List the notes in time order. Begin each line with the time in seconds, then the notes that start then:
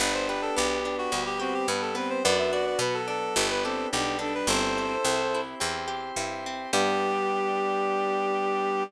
0.00 G1 B3 D4 G4 B4
0.14 C5
0.28 G4 B4
0.42 A4
0.56 B1 B3 G4
0.85 D4
0.98 F#4
1.12 D2 G3 B3 G4
1.26 G4
1.40 C4 F#4 G4
1.54 G4
1.68 G2 B3 D4 B4
1.82 A4
1.95 B3 C4 B4
2.10 C5
2.24 F#2 B3 D4 F#4 D5
2.38 E5
2.53 F#4 D5
2.66 D5
2.79 B2 F#3 B3 F#4 B4
2.94 A4
3.08 D4 A4
3.36 G1 B3 D4 G4
3.50 B4
3.64 C4 G4 A4
3.92 B1 G3 B3 D4 G4
4.19 D4 A4
4.35 B4
4.47 G1 C4 E4 G4 A4 C5
4.78 G4
5.05 C2 C4
5.34 E4
5.60 E2 C4 G4 C5
5.88 G4
6.16 G2 E4
6.46 C4
6.73 G2 G3 B3 D4 G4